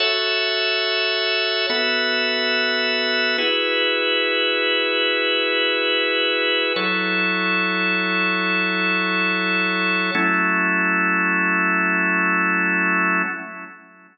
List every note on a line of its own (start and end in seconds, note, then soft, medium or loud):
0.00 1.66 F#4 medium
0.00 1.66 A4 medium
0.00 1.66 C#5 medium
0.00 1.66 E5 medium
1.70 3.37 B3 medium
1.70 3.37 F#4 medium
1.70 3.37 A4 medium
1.70 3.37 E5 medium
3.38 6.73 E4 medium
3.38 6.73 F#4 medium
3.38 6.73 G#4 medium
3.38 6.73 B4 medium
6.76 10.11 F#3 medium
6.76 10.11 E4 medium
6.76 10.11 A4 medium
6.76 10.11 C#5 medium
10.15 13.22 F#3 medium
10.15 13.22 A3 loud
10.15 13.22 C#4 loud
10.15 13.22 E4 loud